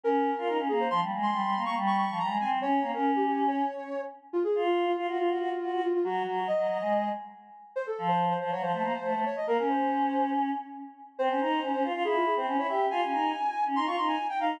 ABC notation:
X:1
M:4/4
L:1/16
Q:1/4=140
K:Fm
V:1 name="Ocarina"
B6 A c | c' z2 c'4 d' z d' d'2 b2 a z | d3 B2 G G2 d6 z2 | [K:Bbm] F A2 F2 F F F F6 F F |
G4 e6 z6 | c =A2 c2 c c d c6 d e | B B c6 z8 | [K:Fm] c8 A F A c2 d =e2 |
a8 c' d' c' a2 g f2 |]
V:2 name="Choir Aahs"
D3 F E D B,2 | F, G, A,2 G, G, B, B, G,3 F, G, A, C2 | D2 B, D7 z6 | [K:Bbm] z2 F4 F G F G G z G G z2 |
G,2 G,2 z G, G, A,3 z6 | z2 F,4 F, G, F, =A, B, z A, A, z2 | B, D9 z6 | [K:Fm] C D E2 D D F F =E3 C D E G2 |
F D E2 z3 D E F E2 z2 E2 |]